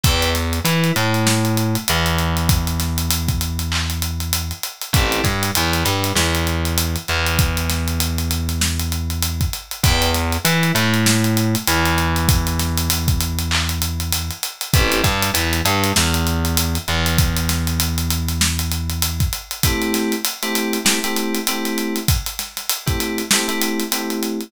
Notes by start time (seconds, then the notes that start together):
0.03 E2 B4 D5 E5 G5, kick, closed hi-hat
0.22 closed hi-hat
0.35 snare, closed hi-hat
0.53 closed hi-hat
0.65 E3 E4, closed hi-hat
0.84 closed hi-hat
0.96 A2 A3, closed hi-hat
1.14 closed hi-hat
1.27 snare
1.45 closed hi-hat
1.57 closed hi-hat
1.75 closed hi-hat
1.88 E2 E3, closed hi-hat
2.06 closed hi-hat
2.18 closed hi-hat
2.37 closed hi-hat
2.49 kick, closed hi-hat
2.67 closed hi-hat
2.80 snare, closed hi-hat
2.98 closed hi-hat
3.10 closed hi-hat
3.28 kick, closed hi-hat
3.41 closed hi-hat
3.59 closed hi-hat
3.72 clap
3.90 closed hi-hat
4.02 closed hi-hat
4.20 closed hi-hat
4.33 closed hi-hat
4.51 closed hi-hat
4.63 closed hi-hat
4.82 closed hi-hat
4.93 A1 C4 E4 G4 A4, kick, closed hi-hat
5.12 closed hi-hat
5.24 G2 G3, kick, snare, closed hi-hat
5.43 closed hi-hat
5.55 E2 E3, closed hi-hat
5.73 closed hi-hat
5.85 G2 G3, closed hi-hat
6.04 snare, closed hi-hat
6.15 E2 E3, snare
6.35 closed hi-hat
6.47 closed hi-hat
6.65 closed hi-hat
6.78 closed hi-hat
6.96 closed hi-hat
7.08 E2 E3, closed hi-hat
7.26 closed hi-hat
7.39 kick, closed hi-hat
7.57 closed hi-hat
7.70 snare, closed hi-hat
7.88 closed hi-hat
8.00 closed hi-hat
8.18 closed hi-hat
8.31 closed hi-hat
8.49 snare, closed hi-hat
8.61 snare
8.79 snare, closed hi-hat
8.92 closed hi-hat
9.10 closed hi-hat
9.22 closed hi-hat
9.41 kick, closed hi-hat
9.53 closed hi-hat
9.71 closed hi-hat
9.83 E2 B4 D5 E5 G5, kick, closed hi-hat
10.02 closed hi-hat
10.14 snare, closed hi-hat
10.32 closed hi-hat
10.45 E3 E4, closed hi-hat
10.63 closed hi-hat
10.75 A2 A3, closed hi-hat
10.94 closed hi-hat
11.06 snare
11.24 closed hi-hat
11.37 closed hi-hat
11.55 closed hi-hat
11.67 E2 E3, closed hi-hat
11.85 closed hi-hat
11.98 closed hi-hat
12.16 closed hi-hat
12.29 kick, closed hi-hat
12.47 closed hi-hat
12.59 snare, closed hi-hat
12.77 closed hi-hat
12.90 closed hi-hat
13.08 kick, closed hi-hat
13.21 closed hi-hat
13.39 closed hi-hat
13.51 clap
13.69 closed hi-hat
13.82 closed hi-hat
14.00 closed hi-hat
14.12 closed hi-hat
14.30 closed hi-hat
14.43 closed hi-hat
14.61 closed hi-hat
14.73 A1 C4 E4 G4 A4, kick, closed hi-hat
14.92 closed hi-hat
15.04 G2 G3, kick, snare, closed hi-hat
15.22 closed hi-hat
15.34 E2 E3, closed hi-hat
15.53 closed hi-hat
15.65 G2 G3, closed hi-hat
15.84 snare, closed hi-hat
15.96 E2 E3, snare
16.14 closed hi-hat
16.27 closed hi-hat
16.45 closed hi-hat
16.57 closed hi-hat
16.75 closed hi-hat
16.88 E2 E3, closed hi-hat
17.06 closed hi-hat
17.18 kick, closed hi-hat
17.36 closed hi-hat
17.49 snare, closed hi-hat
17.67 closed hi-hat
17.80 closed hi-hat
17.98 closed hi-hat
18.10 closed hi-hat
18.28 snare, closed hi-hat
18.41 snare
18.59 snare, closed hi-hat
18.71 closed hi-hat
18.90 closed hi-hat
19.02 closed hi-hat
19.20 kick, closed hi-hat
19.33 closed hi-hat
19.51 closed hi-hat
19.63 A3 C4 E4 G4, kick, closed hi-hat
19.82 closed hi-hat
19.94 snare, closed hi-hat
20.12 closed hi-hat
20.25 closed hi-hat
20.42 A3 C4 E4 G4, closed hi-hat
20.55 closed hi-hat
20.73 closed hi-hat
20.85 A3 C4 E4 G4, snare
21.04 A3 C4 E4 G4, closed hi-hat
21.16 closed hi-hat
21.35 closed hi-hat
21.47 A3 C4 E4 G4, closed hi-hat
21.65 closed hi-hat
21.78 closed hi-hat
21.96 closed hi-hat
22.08 kick, closed hi-hat
22.26 closed hi-hat
22.39 snare, closed hi-hat
22.57 snare, closed hi-hat
22.69 closed hi-hat
22.86 A3 C4 E4 G4, kick, closed hi-hat
23.00 closed hi-hat
23.18 closed hi-hat
23.31 A3 C4 E4 G4, snare
23.48 A3 C4 E4 G4, closed hi-hat
23.61 closed hi-hat
23.79 snare, closed hi-hat
23.91 A3 C4 E4 G4, closed hi-hat
24.10 closed hi-hat
24.23 closed hi-hat
24.41 closed hi-hat